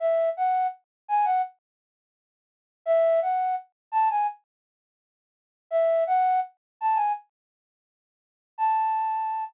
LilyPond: \new Staff { \time 4/4 \key a \major \tempo 4 = 84 e''8 fis''8 r8 gis''16 fis''16 r2 | e''8 fis''8 r8 a''16 gis''16 r2 | e''8 fis''8 r8 a''16 gis''16 r2 | a''4. r2 r8 | }